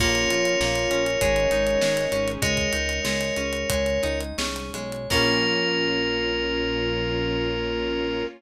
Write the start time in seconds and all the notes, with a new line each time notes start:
0.00 A#1 A#3 C#4 F4 A#4 C#5, kick, crash
0.15 closed hi-hat
0.30 A#1 F4 C#5, closed hi-hat
0.45 closed hi-hat
0.60 A#1 A#3 F5, snare
0.76 closed hi-hat
0.91 A#1 C#4 A#4, closed hi-hat
1.06 closed hi-hat
1.21 G#1 G#3 C#4 D#4 G#4 C#5, kick, closed hi-hat
1.36 closed hi-hat
1.51 G#1 D#4 C#5, closed hi-hat
1.67 closed hi-hat
1.81 G#1 G#3 D#5, snare
1.97 closed hi-hat
2.12 G#1 C#4 G#4, closed hi-hat
2.28 closed hi-hat
2.42 C#2 G#3 G#4 A#4 C#5 D#5, kick, closed hi-hat
2.57 kick, closed hi-hat
2.73 C#2 D#4 C#5, closed hi-hat
2.89 closed hi-hat
3.05 C#2 G#3 D#5, snare
3.21 closed hi-hat
3.37 C#2 C#4 G#4, closed hi-hat
3.53 closed hi-hat
3.70 C#2 G#3 C#5, kick, closed hi-hat
3.86 closed hi-hat
4.03 C#2 D#4 D#5, closed hi-hat
4.21 closed hi-hat
4.38 C2 C#4 G#4, snare
4.56 closed hi-hat
4.74 B1 G#3 C#5, closed hi-hat
4.92 closed hi-hat
5.10 A#1 A#3 C#4 F4 A#4, kick, crash